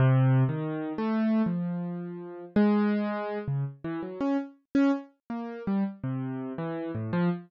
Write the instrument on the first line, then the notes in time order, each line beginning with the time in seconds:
acoustic grand piano
0.00 C3
0.49 D#3
0.98 A3
1.46 F3
2.56 G#3
3.48 C#3
3.84 E3
4.03 F#3
4.21 C#4
4.75 C#4
5.30 A#3
5.67 G3
6.04 C3
6.58 E3
6.95 A2
7.13 F3